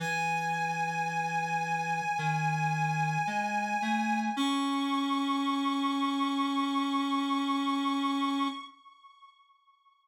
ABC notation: X:1
M:4/4
L:1/8
Q:1/4=55
K:C#m
V:1 name="Clarinet"
g8 | c'8 |]
V:2 name="Clarinet"
E,4 D,2 G, A, | C8 |]